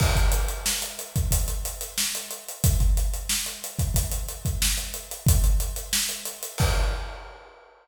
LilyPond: \new DrumStaff \drummode { \time 4/4 \tempo 4 = 91 <cymc bd>16 <hh bd>16 hh16 hh16 sn16 hh16 hh16 <hh bd>16 <hh bd>16 hh16 hh16 hh16 sn16 hh16 hh16 hh16 | <hh bd>16 <hh bd>16 hh16 hh16 sn16 hh16 hh16 <hh bd>16 <hh bd>16 hh16 hh16 <hh bd>16 sn16 hh16 hh16 hh16 | \time 2/4 <hh bd>16 hh16 hh16 hh16 sn16 hh16 hh16 hh16 | \time 4/4 <cymc bd>4 r4 r4 r4 | }